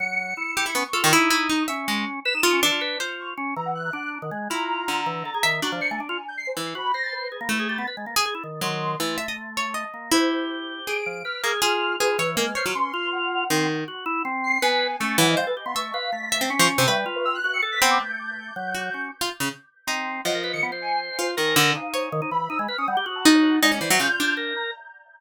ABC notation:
X:1
M:6/8
L:1/16
Q:3/8=107
K:none
V:1 name="Orchestral Harp"
z6 G E B, z A ^D, | E2 E2 ^D2 e2 ^G,2 z2 | z2 F2 D4 c4 | z12 |
E4 D,5 z e2 | D10 E,2 | z8 A,4 | z3 ^G z4 ^F,4 |
E,2 e ^d z2 ^c2 d4 | E8 ^G4 | z2 ^A, z ^G4 G2 ^c2 | ^A, z ^c ^F, z8 |
^D,4 z8 | B,4 A,2 E,2 c z3 | e4 z2 e C z F, z C, | B10 C2 |
z8 ^F4 | z F z ^C, z4 ^D4 | F,10 F2 | ^D,2 =D,2 z2 ^c6 |
z8 ^D4 | ^D ^C E, ^F, ^C, z =D4 z2 |]
V:2 name="Drawbar Organ"
^F,4 E4 ^C z =F2 | ^D6 ^C6 | B ^D D ^C E, F B2 F4 | ^C2 E,4 D3 ^D, ^G,2 |
F6 E,2 A ^G ^D,2 | ^F =F, c A, D =F z6 | ^F2 c4 ^G ^A, E G =G B, | B ^G, ^A, z ^G E ^D,2 D,4 |
A,10 ^A,2 | G10 F,2 | B2 ^G2 F4 F2 E,2 | ^G,2 c F ^C2 F6 |
C2 z2 ^F2 E2 C4 | B3 z ^C2 ^F, =F, G, A G B, | A,2 B2 A,4 ^C4 | G,2 F4 ^F2 A2 B,2 |
A,6 ^F,4 ^C2 | z8 C4 | ^F, ^A B ^D, B, c7 | ^A4 ^D4 ^D, D E,2 |
^D ^G, B ^C =G, G ^F6 | ^G,2 c2 F4 ^A4 |]
V:3 name="Ocarina"
^c''6 c''2 ^c'4 | z12 | e''2 ^c''4 z4 ^c' z | z2 ^a ^f ^f'4 z4 |
^a12 | z d ^c'' ^g z g2 =g' =c'' c z2 | b2 ^a' =a' B2 z4 a'2 | z8 c'4 |
z12 | c4 z4 d''4 | f'8 B4 | f'4 c'4 ^f4 |
z10 c''2 | ^g4 a'2 z ^d f B z c' | ^c'2 f2 b'5 c' z2 | e g z B e' ^f'2 ^c'' z b' d'' d' |
g'12 | z12 | ^d3 ^c'' z2 ^g2 z2 =c2 | z4 f2 c2 z2 b2 |
e' z f' ^d' ^f z2 a a' ^c z f | d3 e g'4 z2 ^a2 |]